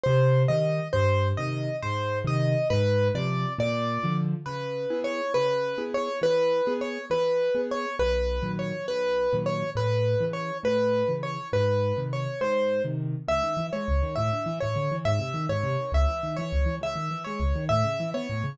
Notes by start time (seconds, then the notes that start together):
0.03 C3 C5
0.48 D#3 G3 D#5
0.93 G2 C5
1.37 C3 D#3 D#5
1.82 G#2 C5
2.24 C3 D#3 D#5
2.70 G#2 B4
3.15 C3 F3 D5
3.59 A#2 D5
4.03 D3 F3
4.46 C#3 B4
4.90 B3 E4 G#4
5.04 C#5
5.34 C#3 B4
5.78 B3 E4 G#4
5.94 C#5
6.22 E3 B4
6.67 B3 G#4
6.81 C#5
7.10 E3 B4
7.55 B3 G#4
7.71 C#5
7.99 B1 B4
8.42 A#2 D#3 F#3
8.59 C#5
8.87 B1 B4
9.33 A#2 D#3 F#3
9.46 C#5
9.75 A2 B4
10.20 C#3 E3
10.33 C#5
10.63 A2 B4
11.08 C#3 E3
11.23 C#5
11.53 G#2 B4
11.96 C3 D#3
12.13 C#5
12.41 G#2 C5
12.84 C3 D#3
13.28 C#2 E5
13.43 D#3
13.57 E3
13.73 G#3 C#5
13.88 C#2
14.02 D#3
14.16 A2 E5
14.33 D3
14.46 E3
14.60 A2 C#5
14.76 D3
14.91 E3
15.05 G#2 E5
15.19 C3
15.34 D#3
15.49 G#2 C#5
15.63 C3
15.80 D#3
15.92 C#2 E5
16.08 E3
16.23 D#3
16.37 E3 C#5
16.52 C#2
16.66 E3
16.81 C#2 E5
16.96 D#3
17.11 E3
17.24 G#3 C#5
17.40 C#2
17.56 D#3
17.69 A2 E5
17.84 C#3
18.00 E3
18.14 B3 C#5
18.30 A2
18.44 C#3